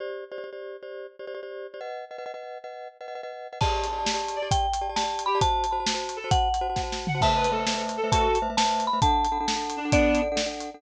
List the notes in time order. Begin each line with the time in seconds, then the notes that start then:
0.00 G4 C5 D5
0.32 G4 C5 D5
0.38 G4 C5 D5
0.44 G4 C5 D5
0.53 G4 C5 D5
0.83 G4 C5 D5
1.19 G4 C5 D5
1.27 G4 C5 D5
1.34 G4 C5 D5
1.43 G4 C5 D5
1.74 G4 C5 D5
1.81 B4 D#5 F#5
2.11 B4 D#5 F#5
2.18 B4 D#5 F#5
2.26 B4 D#5 F#5
2.34 B4 D#5 F#5
2.64 B4 D#5 F#5
3.01 B4 D#5 F#5
3.08 B4 D#5 F#5
3.15 B4 D#5 F#5
3.23 B4 D#5 F#5
3.53 B4 D#5 F#5
3.61 G4 D5 A5, kick, crash
3.84 closed hi-hat
3.93 G4 D5 A5
3.99 G4 D5 A5
4.05 G4 D5 A5, snare
4.14 G4 D5 A5
4.28 closed hi-hat
4.36 D5
4.42 G4 D5 A5
4.51 G5, kick, closed hi-hat
4.73 closed hi-hat
4.81 G4 D5 A5
4.89 G4 D5 A5
4.96 G4 D5 A5, snare
5.04 G4 D5 A5
5.19 closed hi-hat
5.26 G4 B5
5.35 G4 D5 A5
5.41 F#4 C5 A5, kick, closed hi-hat
5.64 closed hi-hat
5.72 F#4 C5 A5
5.80 F#4 C5 A5
5.86 F#4 C5 A5, snare
5.94 F#4 C5 A5
6.09 closed hi-hat
6.16 A4
6.24 F#4 C5 A5
6.31 F#5, kick, closed hi-hat
6.54 closed hi-hat
6.61 F#4 C5 A5
6.69 F#4 C5 A5
6.76 F#4 C5 A5, kick, snare
6.83 F#4 C5 A5
6.92 snare
7.07 F#5, floor tom
7.15 F#4 C5 A5
7.21 A3 B4 C5 E5 A5, kick, crash
7.36 B4
7.44 closed hi-hat
7.52 A3 A4 B4 C5 E5
7.59 A3 B4 C5 E5
7.67 A3 B4 C5 E5, snare
7.74 A3 B4 C5 E5
7.89 closed hi-hat
7.97 A4
8.04 A3 B4 C5 E5
8.12 F#4 A4 A5, kick, closed hi-hat
8.35 closed hi-hat
8.42 A3 B4 C5 E5
8.50 A3 B4 C5 E5
8.57 A3 B4 C5 E5 A5, snare
8.65 A3 B4 C5 E5
8.80 closed hi-hat
8.87 B5
8.93 A3 B4 C5 E5
9.02 D4 A4 F#5 A5, kick, closed hi-hat
9.25 closed hi-hat
9.32 D4 A4 F#5
9.40 D4 A4 F#5
9.48 D4 A4 F#5, snare
9.56 D4 A4 F#5
9.70 closed hi-hat
9.77 D4
9.85 D4 A4 F#5
9.92 B3 D4 D5, kick, closed hi-hat
10.15 closed hi-hat
10.22 D4 A4 F#5
10.32 D4 A4 F#5
10.36 D4 A4 F#5, snare
10.46 D4 A4 F#5
10.60 closed hi-hat
10.74 D4 A4 F#5